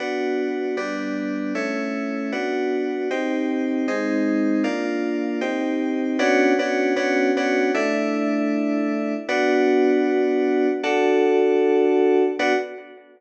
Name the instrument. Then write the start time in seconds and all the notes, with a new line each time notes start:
electric piano 2
0.00 B3 D4 F#4
0.77 G3 B3 D4
1.55 A3 C#4 E4
2.32 B3 D4 F#4
3.11 C4 D#4 G4
3.88 G#3 C4 D#4
4.64 A#3 D4 F4
5.41 C4 D#4 G4
6.19 B3 C#4 D4 F#4
6.59 B3 C#4 D4 F#4
6.96 B3 C#4 D4 F#4
7.37 B3 C#4 D4 F#4
7.74 A3 D4 E4
9.29 B3 D4 F#4
10.83 D4 F#4 A4
12.39 B3 D4 F#4